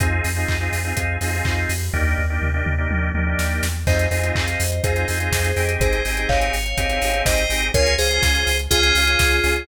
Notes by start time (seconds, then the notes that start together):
0.00 F2 C4 D#4 F4 G#4, kick, closed hi-hat
0.24 F2, open hi-hat
0.36 C4 D#4 F4 G#4
0.48 F2, kick, clap
0.60 C4 D#4 F4 G#4
0.72 F2, open hi-hat
0.85 C4 D#4 F4 G#4
0.96 F2 C4 D#4 F4 G#4, kick, closed hi-hat
1.21 F2 C4 D#4 F4 G#4, open hi-hat
1.33 C4 D#4 F4 G#4
1.45 F2, kick, clap
1.69 F2, open hi-hat
1.93 D#2 A#3 D4 D#4 G4, kick, floor tom
2.18 D#2, floor tom
2.30 A#3 D4 D#4 G4
2.41 D#2, mid tom
2.54 A#3 D4 D#4 G4
2.66 D#2, mid tom
2.78 A#3 D4 D#4 G4
2.90 D#2 A#3 D4 D#4 G4, high tom
3.14 D#2 A#3 D4 D#4 G4, high tom
3.27 A#3 D4 D#4 G4
3.38 D#2, snare
3.63 E2, snare
3.87 F2 C4 D#4 F4 G#4 C5 D#5, kick, crash
3.99 closed hi-hat
4.11 F2 C4 D#4 F4 G#4 C5 D#5, open hi-hat
4.23 C4 D#4 F4 G#4, closed hi-hat
4.35 F2, kick, clap
4.48 closed hi-hat
4.60 F2, open hi-hat
4.72 closed hi-hat
4.84 F2 C4 D#4 F4 G#4 C5, kick, closed hi-hat
4.96 C4 D#4 F4 G#4, closed hi-hat
5.08 F2 C4 D#4 F4 G#4, open hi-hat
5.20 C4 D#4 F4 G#4, closed hi-hat
5.32 F2, kick, snare
5.44 closed hi-hat
5.56 F2 C4 D#4 G4 G#4, open hi-hat
5.69 closed hi-hat
5.80 G#1 G#4 C5, kick, closed hi-hat
5.93 closed hi-hat
6.05 G#1 C4 D#4 G4 G#4, open hi-hat
6.17 C4 D#4 G4 G#4, closed hi-hat
6.29 G#1 C#5 F5, kick, clap
6.41 closed hi-hat
6.53 G#1, open hi-hat
6.66 closed hi-hat
6.78 G#1 C4 D#4 G4 G#4, kick, closed hi-hat
6.90 C4 D#4 G4 G#4, closed hi-hat
7.02 G#1 C4 D#4 G4 G#4, open hi-hat
7.13 C4 D#4 G4 G#4, closed hi-hat
7.26 G#1 C5 D#5, kick, snare
7.38 closed hi-hat
7.50 G#1 C4 D#4 G4 G#4, open hi-hat
7.62 closed hi-hat
7.74 C#2 C#4 F4 G#4 A#4 C#5, kick, closed hi-hat
7.86 closed hi-hat
7.98 C#2 C#4 F4 G#4 C5, open hi-hat
8.10 C#4 F4 G#4, closed hi-hat
8.22 C#2, kick, snare
8.35 closed hi-hat
8.47 C#2, open hi-hat
8.59 closed hi-hat
8.71 C#2 C#4 F4 G#4, kick, closed hi-hat
8.83 C#4 F4 G#4, closed hi-hat
8.95 C#2 C#4 F4 G#4, open hi-hat
9.07 C#4 F4 G#4, closed hi-hat
9.19 C#2, kick, snare
9.31 closed hi-hat
9.44 C#2 C#4 F4 G#4, open hi-hat
9.56 closed hi-hat